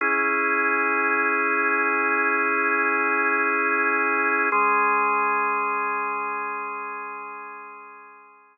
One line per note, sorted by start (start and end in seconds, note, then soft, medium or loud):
0.01 4.49 C#4 loud
0.01 4.49 E4 medium
0.01 4.49 G#4 medium
4.52 8.58 G#3 medium
4.52 8.58 C#4 medium
4.52 8.58 G#4 loud